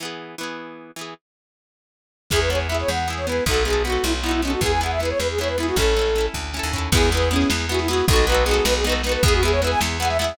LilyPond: <<
  \new Staff \with { instrumentName = "Flute" } { \time 6/8 \key e \major \tempo 4. = 104 r2. | r2. | gis'16 b'16 cis''16 r16 e''16 cis''16 fis''8 r16 cis''16 b'8 | a'8 gis'8 fis'8 e'16 r16 e'16 e'16 cis'16 fis'16 |
gis'16 gis''16 fis''16 e''16 b'16 cis''16 b'16 gis'16 cis''16 b'16 e'16 fis'16 | a'4. r4. | gis'8 b'8 cis'8 r8 fis'16 e'16 fis'8 | a'8 b'8 gis'8 b'16 gis'16 b'16 r16 b'16 b'16 |
gis'16 fis'16 gis'16 cis''16 b'16 gis''16 r8 fis''16 e''16 e''8 | }
  \new Staff \with { instrumentName = "Orchestral Harp" } { \time 6/8 \key e \major <e b gis'>4 <e b gis'>4. <e b gis'>8 | r2. | <b e' gis'>8 <b e' gis'>8 <b e' gis'>4 <b e' gis'>8 <b e' gis'>8 | <b dis' fis' a'>8 <b dis' fis' a'>8 <b dis' fis' a'>4 <b dis' fis' a'>8 <b dis' fis' a'>8 |
<b e' gis'>8 <b e' gis'>8 <b e' gis'>4 <b e' gis'>8 <b e' gis'>8 | <cis' e' a'>8 <cis' e' a'>8 <cis' e' a'>4 <cis' e' a'>8 <cis' e' a'>8 | <b e' gis'>8 <b e' gis'>8 <b e' gis'>4 <b e' gis'>8 <b e' gis'>8 | <b dis' fis' a'>8 <b dis' fis' a'>8 <b dis' fis' a'>4 <b dis' fis' a'>8 <b dis' fis' a'>8 |
<b e' gis'>8 <b e' gis'>8 <b e' gis'>4 <b e' gis'>8 <b e' gis'>8 | }
  \new Staff \with { instrumentName = "Electric Bass (finger)" } { \clef bass \time 6/8 \key e \major r2. | r2. | e,4. e,4. | b,,4. b,,4. |
e,4. e,4. | a,,4. d,8. dis,8. | e,4. e,4. | b,,4. b,,4. |
e,4. e,4. | }
  \new DrumStaff \with { instrumentName = "Drums" } \drummode { \time 6/8 r4. r4. | r4. r4. | <cymc bd sn>16 sn16 sn16 sn16 sn16 sn16 sn16 sn16 sn16 sn16 sn16 sn16 | <bd sn>16 sn16 sn16 sn16 sn16 sn16 sn16 sn16 sn16 sn16 sn16 sn16 |
<bd sn>16 sn16 sn16 sn16 sn16 sn16 sn16 sn16 sn16 sn16 sn16 sn16 | <bd sn>16 sn16 sn16 sn16 sn16 sn16 <bd sn>8 sn8 tomfh8 | <cymc bd sn>16 sn16 sn16 sn16 sn16 sn16 sn16 sn16 sn16 sn16 sn16 sn16 | <bd sn>16 sn16 sn16 sn16 sn16 sn16 sn16 sn16 sn16 sn16 sn16 sn16 |
<bd sn>16 sn16 sn16 sn16 sn16 sn16 sn16 sn16 sn16 sn16 sn16 sn16 | }
>>